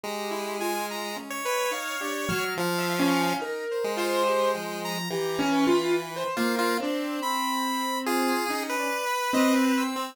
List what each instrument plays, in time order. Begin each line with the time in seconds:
0.04 lead 1 (square) G#3, acoustic grand piano G4, lead 2 (sawtooth) A#5
0.30 lead 2 (sawtooth) E4
0.60 acoustic grand piano F4, lead 2 (sawtooth) G#5
0.90 lead 2 (sawtooth) A#5
1.16 acoustic grand piano G#3, lead 2 (sawtooth) C#4
1.30 lead 1 (square) C#5
1.45 lead 2 (sawtooth) B4
1.71 lead 2 (sawtooth) D#4, acoustic grand piano F5
2.00 acoustic grand piano D4, lead 2 (sawtooth) G4
2.28 acoustic grand piano F#3, lead 2 (sawtooth) F6
2.57 lead 1 (square) F3, lead 2 (sawtooth) F5
2.78 acoustic grand piano E5
2.99 acoustic grand piano C#4
3.39 lead 2 (sawtooth) D#4, acoustic grand piano A#4
3.71 lead 2 (sawtooth) C5
3.84 lead 1 (square) G#3
3.96 lead 2 (sawtooth) F4, acoustic grand piano C5
4.26 lead 2 (sawtooth) G4
4.54 acoustic grand piano F3, lead 2 (sawtooth) G5
4.84 lead 2 (sawtooth) A#5
5.09 lead 1 (square) E3, acoustic grand piano G4, lead 2 (sawtooth) A#5
5.39 acoustic grand piano C#4
5.52 lead 2 (sawtooth) B4
5.67 acoustic grand piano F4
6.16 acoustic grand piano C5
6.36 acoustic grand piano A#3, lead 1 (square) F4, lead 2 (sawtooth) C5
6.59 lead 1 (square) F4
6.80 acoustic grand piano C4, lead 2 (sawtooth) D4
7.22 lead 2 (sawtooth) B5
8.06 lead 2 (sawtooth) F4, lead 1 (square) G#4
8.49 acoustic grand piano C#4, lead 2 (sawtooth) D#4
8.70 lead 1 (square) B4
8.79 lead 2 (sawtooth) D5
9.05 lead 2 (sawtooth) B5
9.33 acoustic grand piano C4, lead 2 (sawtooth) D#5
9.53 lead 2 (sawtooth) C4
9.77 lead 2 (sawtooth) E6
9.96 lead 1 (square) C4